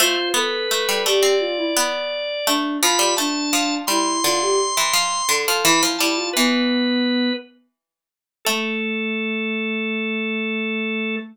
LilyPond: <<
  \new Staff \with { instrumentName = "Drawbar Organ" } { \time 4/4 \key a \minor \tempo 4 = 85 c''8 b'4 d''2~ d''8 | b''8 a''4 c'''2~ c'''8 | b''16 r16 a''8 b'4. r4. | a'1 | }
  \new Staff \with { instrumentName = "Ocarina" } { \time 4/4 \key a \minor f'8 a'4 g'8 f'16 e'16 r4 d'8 | f'8 d'4 e'8 f'16 g'16 r4 a'8 | e'8 e'16 f'16 b4. r4. | a1 | }
  \new Staff \with { instrumentName = "Pizzicato Strings" } { \time 4/4 \key a \minor a16 r16 b8 a16 g16 a16 c'8. b4 a8 | f16 g16 a8 f8 g8 d8. e16 f8 d16 f16 | e16 f16 g8 e2~ e8 r8 | a1 | }
>>